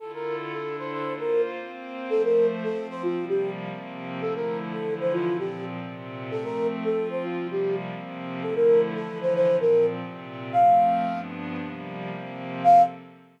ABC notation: X:1
M:4/4
L:1/16
Q:1/4=114
K:F
V:1 name="Flute"
A B2 z A2 c c2 B2 z5 | A B2 z A2 c F2 G2 z5 | A B2 z A2 c F2 G2 z5 | A B2 z A2 c F2 G2 z5 |
A B2 z A2 c c2 B2 z5 | f6 z10 | f4 z12 |]
V:2 name="Pad 5 (bowed)"
[D,EFA]4 [D,DEA]4 [B,Fc]4 [B,Cc]4 | [F,A,c]4 [F,Cc]4 [C,F,G,B,]4 [C,F,B,C]4 | [D,F,A,E]4 [D,E,F,E]4 [B,,F,C]4 [B,,C,C]4 | [F,A,C]4 [F,CF]4 [C,F,G,B,]4 [C,F,B,C]4 |
[D,F,A,E]4 [D,E,F,E]4 [B,,F,C]4 [B,,C,C]4 | [F,A,C]4 [G,,F,=B,D]4 [C,F,G,_B,]4 [C,F,B,C]4 | [F,CA]4 z12 |]